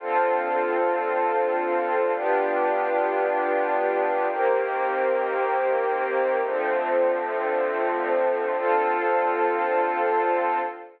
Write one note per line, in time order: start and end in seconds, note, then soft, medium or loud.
0.00 2.12 D3 medium
0.00 2.12 C4 medium
0.00 2.12 F4 medium
0.00 2.12 A4 medium
2.14 4.26 B3 medium
2.14 4.26 D4 loud
2.14 4.26 F4 medium
2.14 4.26 G4 medium
4.29 6.41 D#3 medium
4.29 6.41 A#3 loud
4.29 6.41 C4 medium
4.29 6.41 G4 medium
6.43 8.55 D3 medium
6.43 8.55 F3 loud
6.43 8.55 A3 medium
6.43 8.55 C4 medium
8.57 10.58 D3 medium
8.57 10.58 C4 medium
8.57 10.58 F4 loud
8.57 10.58 A4 loud